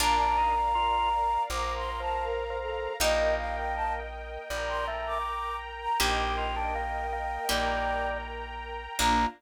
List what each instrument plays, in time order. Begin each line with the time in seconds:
0.00 electric bass (finger) A#1, orchestral harp A#3 D4 F4, drawbar organ D4, string ensemble 1 A#4 D5 F5, flute A#5
0.19 drawbar organ D4
0.38 drawbar organ D#4
0.75 drawbar organ F4
1.49 electric bass (finger) A#1, drawbar organ F3, string ensemble 1 A#4 F5 A#5, flute D6
1.77 flute C6
2.00 drawbar organ F3, flute A5
2.23 flute A#4
2.50 drawbar organ F3
2.62 flute A4
3.00 electric bass (finger) A#1, drawbar organ A#3, orchestral harp A#3 D#4 G4, string ensemble 1 A#4 D#5 G5, flute D#5
3.38 flute F5
3.57 flute G5
3.75 flute A5
4.50 electric bass (finger) A#1, drawbar organ G3, string ensemble 1 A#4 G5 A#5
4.69 flute C6
4.88 drawbar organ A3
5.07 flute D6
5.81 flute A#5
6.00 electric bass (finger) A#1, orchestral harp A#3 D#4 G4, drawbar organ G4, string ensemble 1 A#4 D#5 G5, flute G5
6.38 drawbar organ F4
6.56 drawbar organ D4
6.75 drawbar organ A#3
7.12 drawbar organ A#3
7.49 electric bass (finger) A#1, drawbar organ G3, orchestral harp A#3 D#4 G4, string ensemble 1 A#4 G5 A#5
8.99 electric bass (finger) A#1, orchestral harp A#3 D4 F4, string ensemble 1 A#3 D4 F4, drawbar organ A#3, flute A#5